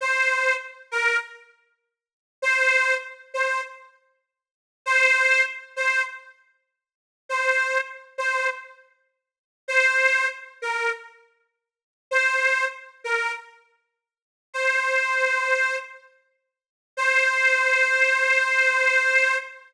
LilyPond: \new Staff { \time 4/4 \key c \major \tempo 4 = 99 c''4 r8 bes'8 r2 | c''4 r8 c''8 r2 | c''4 r8 c''8 r2 | c''4 r8 c''8 r2 |
c''4 r8 bes'8 r2 | c''4 r8 bes'8 r2 | c''2~ c''8 r4. | c''1 | }